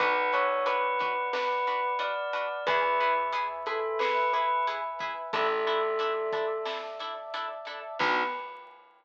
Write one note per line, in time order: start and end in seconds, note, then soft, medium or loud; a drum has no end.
0.00 2.46 B1 medium
0.00 0.13 D4 loud
0.00 0.13 F#4 loud
0.00 0.13 B4 loud
0.00 2.63 B4 medium
0.00 0.30 B4 loud
0.00 2.63 D5 medium
0.00 2.63 F#5 medium
0.00 kick medium
0.00 closed hi-hat medium
0.33 0.47 D4 loud
0.33 0.47 F#4 medium
0.33 0.47 B4 loud
0.33 0.65 C#5 loud
0.33 closed hi-hat medium
0.66 0.79 D4 medium
0.66 0.79 F#4 medium
0.66 0.79 B4 loud
0.66 1.28 B4 loud
0.66 closed hi-hat medium
0.99 1.14 D4 medium
0.99 1.14 F#4 medium
0.99 1.14 B4 loud
0.99 kick medium
0.99 closed hi-hat medium
1.33 1.47 D4 loud
1.33 1.47 F#4 medium
1.33 1.93 B4 loud
1.33 1.47 B4 loud
1.33 snare loud
1.67 1.81 D4 loud
1.67 1.81 F#4 medium
1.67 1.81 B4 medium
1.67 closed hi-hat medium
1.99 2.12 D4 loud
1.99 2.12 F#4 medium
1.99 2.12 B4 medium
1.99 2.64 D5 loud
1.99 closed hi-hat medium
2.33 2.47 D4 loud
2.33 2.47 F#4 medium
2.33 2.47 B4 loud
2.33 closed hi-hat medium
2.67 5.12 E2 medium
2.67 2.81 E4 loud
2.67 2.81 G#4 loud
2.67 3.14 B4 loud
2.67 5.32 B4 medium
2.67 2.81 B4 loud
2.67 5.32 E5 medium
2.67 5.32 G#5 medium
2.67 kick medium
2.67 closed hi-hat loud
3.00 3.14 E4 medium
3.00 3.14 G#4 medium
3.00 3.14 B4 loud
3.00 closed hi-hat medium
3.33 3.47 E4 medium
3.33 3.47 G#4 loud
3.33 3.47 B4 loud
3.33 closed hi-hat loud
3.66 3.80 E4 loud
3.66 3.80 G#4 medium
3.66 3.98 A4 loud
3.66 3.80 B4 loud
3.66 closed hi-hat medium
3.99 4.13 E4 loud
3.99 4.13 G#4 medium
3.99 4.13 B4 medium
3.99 4.29 B4 loud
3.99 snare loud
4.33 4.47 E4 loud
4.33 4.47 G#4 medium
4.33 4.64 B4 loud
4.33 4.47 B4 loud
4.33 closed hi-hat medium
4.67 4.81 E4 loud
4.67 4.81 G#4 loud
4.67 4.81 B4 loud
4.67 closed hi-hat medium
4.99 5.14 E4 loud
4.99 5.14 G#4 loud
4.99 5.14 B4 loud
4.99 kick medium
4.99 closed hi-hat medium
5.33 7.78 A1 medium
5.33 5.47 D4 loud
5.33 5.47 E4 loud
5.33 6.51 A4 loud
5.33 5.47 A4 loud
5.33 7.98 D5 medium
5.33 7.98 E5 medium
5.33 7.98 A5 medium
5.33 kick medium
5.33 closed hi-hat medium
5.67 5.81 D4 medium
5.67 5.81 E4 loud
5.67 5.81 A4 loud
5.67 closed hi-hat soft
5.99 6.13 D4 loud
5.99 6.13 E4 loud
5.99 6.13 A4 medium
5.99 closed hi-hat medium
6.32 6.46 D4 medium
6.32 6.46 E4 medium
6.32 6.46 A4 medium
6.32 kick medium
6.32 closed hi-hat medium
6.65 6.79 D4 medium
6.65 6.79 E4 medium
6.65 6.79 A4 medium
6.65 snare medium
6.99 7.14 D4 medium
6.99 7.14 E4 loud
6.99 7.14 A4 medium
6.99 closed hi-hat medium
7.34 7.47 D4 loud
7.34 7.47 E4 medium
7.34 7.47 A4 loud
7.34 closed hi-hat medium
7.65 7.80 D4 medium
7.65 7.80 E4 medium
7.65 7.80 A4 medium
7.65 closed hi-hat medium
7.99 8.23 B1 loud
7.99 8.23 B3 loud
7.99 8.23 D4 medium
7.99 8.23 D4 loud
7.99 8.23 F#4 loud
7.99 8.23 B4 loud
7.99 kick loud
7.99 crash loud